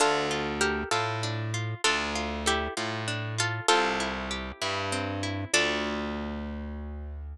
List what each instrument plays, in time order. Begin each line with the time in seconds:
0.00 electric bass (finger) D2, acoustic guitar (steel) D4, pizzicato strings F4 A4
0.31 acoustic guitar (steel) F4
0.61 pizzicato strings G4 A#4, acoustic guitar (steel) A4
0.91 electric bass (finger) A2, pizzicato strings F4 A4, acoustic guitar (steel) F4
1.23 acoustic guitar (steel) D4
1.54 acoustic guitar (steel) F4
1.84 electric bass (finger) D2, acoustic guitar (steel) D4, pizzicato strings F4 A4
2.15 acoustic guitar (steel) F4
2.46 pizzicato strings E4 G4, acoustic guitar (steel) A4
2.77 electric bass (finger) A2, acoustic guitar (steel) F4
3.08 acoustic guitar (steel) D4
3.38 acoustic guitar (steel) F4, pizzicato strings F4 A4
3.68 electric bass (finger) C2, acoustic guitar (steel) C4, pizzicato strings F4 A4
4.00 acoustic guitar (steel) E4
4.31 acoustic guitar (steel) G4
4.62 electric bass (finger) G2, acoustic guitar (steel) E4
4.92 acoustic guitar (steel) C4
5.23 acoustic guitar (steel) E4
5.53 electric bass (finger) D2, acoustic guitar (steel) D4 F4 A4, pizzicato strings D5